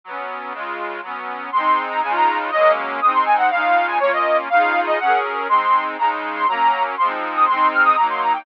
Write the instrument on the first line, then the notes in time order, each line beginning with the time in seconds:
accordion
0.04 F#3 B3
0.10 C#4
0.52 C#3 G#3
0.57 F4
1.01 F#3 B3
1.07 C#4
1.52 G#3 C4 C6
1.58 D#4
1.89 A#5
2.02 C#3 G#3 G#5
2.08 D#4 F4
2.15 A#5
2.51 F#3 G#3 D#5
2.57 A#3 C#4
3.01 G#3 C4 D#6
3.07 D#4
3.14 C6
3.25 G#5
3.37 F#5
3.50 C#3 G#3 F5
3.56 D#4 F4
3.87 G#5
4.00 A#3 C#4 C#5
4.05 F4
4.13 D#5
4.50 C#3 D#4 F5
4.56 F4 G#4
4.87 D#5
4.99 F#3 C#4 F#5
5.04 G#4 A#4
5.48 G#3 C4 C6
5.54 D#4
5.97 C#3 G#3 A#5
6.03 D#4
6.35 C6
6.47 F#3 A#3 A#5
6.52 C#4
6.97 F3 C6
7.01 G#3 C4
7.07 D#4
7.35 D#6
7.47 G#3 C4 C6
7.53 D#4
7.72 F6
7.85 D#6
7.97 F#3 A#3 A#5
8.02 D#4
8.10 C6
8.21 A#5
8.33 G5